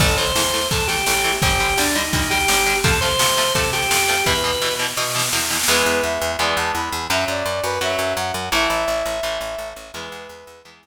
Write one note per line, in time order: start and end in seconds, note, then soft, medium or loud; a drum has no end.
0.00 0.32 A1 loud
0.00 0.07 E3 medium
0.00 0.07 A3 loud
0.00 0.16 A4 medium
0.00 kick loud
0.00 snare loud
0.09 snare medium
0.18 0.25 E3 medium
0.18 0.25 A3 medium
0.18 0.67 C5 medium
0.18 snare medium
0.26 snare medium
0.35 0.67 E2 medium
0.35 0.43 E3 medium
0.35 0.43 A3 medium
0.35 snare loud
0.45 snare medium
0.53 0.60 E3 medium
0.53 0.60 A3 medium
0.53 snare medium
0.62 snare medium
0.71 1.03 E2 medium
0.71 0.78 E3 medium
0.71 0.78 A3 medium
0.71 0.87 A4 medium
0.71 kick loud
0.71 snare medium
0.80 snare medium
0.88 0.96 E3 medium
0.88 0.96 A3 medium
0.88 1.33 G4 medium
0.88 snare loud
0.97 snare medium
1.06 1.39 A1 medium
1.06 1.14 E3 medium
1.06 1.14 A3 medium
1.06 snare loud
1.15 snare medium
1.24 1.31 E3 medium
1.24 1.31 A3 medium
1.24 snare medium
1.32 snare medium
1.42 1.74 G1 loud
1.42 1.49 D3 medium
1.42 1.49 G3 medium
1.42 1.77 G4 medium
1.42 kick loud
1.42 snare medium
1.51 snare medium
1.60 1.67 D3 medium
1.60 1.67 G3 medium
1.60 snare medium
1.69 snare medium
1.77 2.09 D2 medium
1.77 1.85 D3 medium
1.77 1.85 G3 medium
1.77 1.95 D4 medium
1.77 snare loud
1.86 snare loud
1.95 2.02 D3 medium
1.95 2.02 G3 medium
1.95 2.28 D#4 medium
1.95 snare medium
2.05 snare medium
2.13 2.45 D2 loud
2.13 2.20 D3 medium
2.13 2.20 G3 medium
2.13 kick loud
2.13 snare medium
2.22 snare medium
2.30 2.38 D3 medium
2.30 2.38 G3 medium
2.30 2.76 G4 loud
2.30 snare loud
2.40 snare medium
2.48 2.80 G1 medium
2.48 2.56 D3 medium
2.48 2.56 G3 medium
2.48 snare loud
2.57 snare medium
2.66 2.73 D3 medium
2.66 2.73 G3 medium
2.66 snare medium
2.75 snare medium
2.84 3.16 F2 loud
2.84 2.91 C3 medium
2.84 2.91 F3 medium
2.84 2.91 A3 medium
2.84 2.99 A4 medium
2.84 kick loud
2.84 snare loud
2.93 snare medium
3.01 3.09 C3 medium
3.01 3.09 F3 medium
3.01 3.09 A3 medium
3.01 3.53 C5 medium
3.01 snare medium
3.10 snare medium
3.19 3.27 C3 medium
3.19 3.52 C3 medium
3.19 3.27 F3 medium
3.19 3.27 A3 medium
3.19 snare loud
3.29 snare medium
3.37 3.44 C3 medium
3.37 3.44 F3 medium
3.37 3.44 A3 medium
3.37 snare loud
3.46 snare medium
3.55 3.62 C3 medium
3.55 3.87 C3 loud
3.55 3.62 F3 medium
3.55 3.62 A3 medium
3.55 3.70 A4 medium
3.55 kick loud
3.55 snare medium
3.64 snare medium
3.73 3.80 C3 medium
3.73 3.80 F3 medium
3.73 3.80 A3 medium
3.73 4.24 G4 medium
3.73 snare medium
3.82 snare medium
3.90 4.23 F2 medium
3.90 3.98 C3 medium
3.90 3.98 F3 medium
3.90 3.98 A3 medium
3.90 snare loud
3.99 snare medium
4.08 4.15 C3 medium
4.08 4.15 F3 medium
4.08 4.15 A3 medium
4.08 snare loud
4.17 snare medium
4.26 4.58 E2 loud
4.26 4.33 B2 medium
4.26 4.33 E3 medium
4.26 4.74 B4 medium
4.26 kick medium
4.26 snare medium
4.35 snare medium
4.44 4.51 B2 medium
4.44 4.51 E3 medium
4.44 snare medium
4.53 snare medium
4.62 4.69 B2 medium
4.62 4.94 B2 medium
4.62 4.69 E3 medium
4.62 snare medium
4.71 snare medium
4.79 4.86 B2 medium
4.79 4.86 E3 medium
4.79 snare medium
4.88 snare medium
4.97 5.04 B2 medium
4.97 5.29 B2 loud
4.97 5.04 E3 medium
4.97 snare medium
5.02 snare medium
5.06 snare medium
5.10 snare loud
5.14 5.22 B2 medium
5.14 5.22 E3 medium
5.14 snare medium
5.19 snare loud
5.23 snare loud
5.29 snare loud
5.32 5.65 E2 medium
5.32 5.40 B2 medium
5.32 5.40 E3 medium
5.32 snare loud
5.37 snare loud
5.41 snare medium
5.46 snare loud
5.50 5.57 B2 medium
5.50 5.57 E3 medium
5.50 snare loud
5.54 snare loud
5.59 snare loud
5.63 snare loud
5.68 5.83 E2 loud
5.68 6.32 E3 loud
5.68 6.32 G#3 loud
5.68 6.32 B3 loud
5.68 6.02 B4 medium
5.86 6.01 E2 loud
6.03 6.18 E2 medium
6.03 6.31 E5 medium
6.21 6.37 E2 loud
6.39 6.54 E2 medium
6.39 7.03 E3 medium
6.39 7.03 G#3 medium
6.39 7.03 B3 loud
6.39 6.56 D5 medium
6.56 6.72 E2 loud
6.56 6.71 A5 medium
6.74 6.90 E2 medium
6.74 7.05 B5 medium
6.92 7.08 E2 loud
7.10 7.25 F#2 loud
7.10 7.74 F#3 medium
7.10 7.74 C#4 loud
7.10 7.24 E5 medium
7.28 7.43 F#2 medium
7.28 7.63 D5 medium
7.46 7.61 F#2 loud
7.63 7.79 F#2 loud
7.63 7.79 B4 medium
7.81 7.96 F#2 medium
7.81 8.45 F#3 medium
7.81 8.45 C#4 medium
7.81 8.13 E5 medium
7.99 8.14 F#2 loud
8.17 8.32 F#2 loud
8.17 8.46 F#5 medium
8.34 8.49 F#2 loud
8.52 8.67 A1 loud
8.52 9.16 E3 loud
8.52 9.16 A3 loud
8.52 9.69 E5 medium
8.70 8.85 A1 medium
8.88 9.03 A1 medium
9.05 9.21 A1 loud
9.23 9.38 A1 loud
9.23 9.87 E3 medium
9.23 9.87 A3 medium
9.41 9.56 A1 medium
9.58 9.73 A1 medium
9.76 9.91 A1 medium
9.93 10.09 E2 loud
9.93 10.58 E3 loud
9.93 10.58 G#3 loud
9.93 10.58 B3 medium
9.93 10.60 B4 medium
10.12 10.27 E2 loud
10.29 10.44 E2 medium
10.47 10.62 E2 loud
10.65 10.80 E2 medium
10.65 10.87 E3 medium
10.65 10.87 G#3 medium
10.65 10.87 B3 medium
10.83 10.87 E2 medium